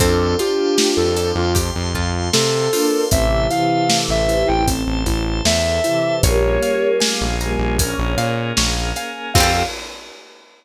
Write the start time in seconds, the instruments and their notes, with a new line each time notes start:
0.00 synth bass 1 F2, acoustic grand piano C4, pizzicato strings C4, choir aahs D4 F4, flute A4, drawbar organ C5 F5 G5 A5, kick, closed hi-hat
0.38 choir aahs D4 F4, acoustic grand piano F4, pizzicato strings F4, flute G4, closed hi-hat
0.77 acoustic grand piano G4, pizzicato strings G4, snare
0.96 synth bass 1 F2, flute A4
1.17 pizzicato strings A4, acoustic grand piano A4, closed hi-hat
1.35 synth bass 1 F2, flute F4
1.55 pizzicato strings G4, acoustic grand piano G4, drawbar organ C5 F5 A5 C6, kick, closed hi-hat
1.76 synth bass 1 F2
1.94 synth bass 1 F2, acoustic grand piano F4, pizzicato strings F4, kick
2.33 synth bass 1 C3, pizzicato strings C4, acoustic grand piano C4, flute A4, snare
2.73 choir aahs A#3 D4, acoustic grand piano F4, pizzicato strings F4, open hi-hat
3.11 synth bass 1 A1, choir aahs C3 E3, acoustic grand piano C4, drawbar organ C5 E5 A5, flute E5, kick, closed hi-hat
3.50 choir aahs C3 E3, acoustic grand piano E4, flute F5, closed hi-hat
3.89 acoustic grand piano A4, snare
4.09 synth bass 1 A1, flute E5
4.28 acoustic grand piano E4, closed hi-hat
4.47 synth bass 1 A1, flute G5
4.67 acoustic grand piano C4, drawbar organ A4 C5 A5, kick, closed hi-hat
4.87 synth bass 1 A1
5.06 synth bass 1 A1, acoustic grand piano E4, kick, closed hi-hat
5.45 synth bass 1 E2, acoustic grand piano A4, flute E5, snare
5.84 choir aahs C3 E3, acoustic grand piano E4, closed hi-hat
6.23 synth bass 1 A#1, choir aahs G3 A#3, drawbar organ A#3 C#4 F4 G#4, acoustic grand piano A#4, pizzicato strings C#5, flute C#5, kick, closed hi-hat
6.62 acoustic grand piano C#5, pizzicato strings F5, closed hi-hat
7.00 acoustic grand piano F5, pizzicato strings G#5, snare
7.21 synth bass 1 A#1
7.40 choir aahs G3 A#3, acoustic grand piano G#5, pizzicato strings A#5, closed hi-hat
7.59 synth bass 1 A#1
7.79 choir aahs A#3 C#4, drawbar organ A#3 C#4 G#4 A#4, acoustic grand piano A#4, pizzicato strings G#5, kick, closed hi-hat
7.98 synth bass 1 A#1
8.17 synth bass 1 A#2, acoustic grand piano C#5, pizzicato strings F5, closed hi-hat
8.57 synth bass 1 A#1, pizzicato strings C#5, acoustic grand piano F5, snare
8.96 pizzicato strings F5, acoustic grand piano G#5, closed hi-hat
9.34 synth bass 1 F2, pizzicato strings C4 F4, acoustic grand piano C4 F4 G4 A4, drawbar organ C4 F4 G4 A4, choir aahs F4, flute F5, kick, crash
9.40 pizzicato strings G4 A4